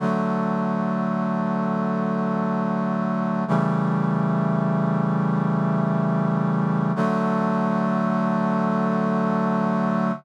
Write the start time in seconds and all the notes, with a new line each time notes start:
0.00 D3 F#3 A3
3.48 C#3 E3 G3 A3
6.96 D3 F#3 A3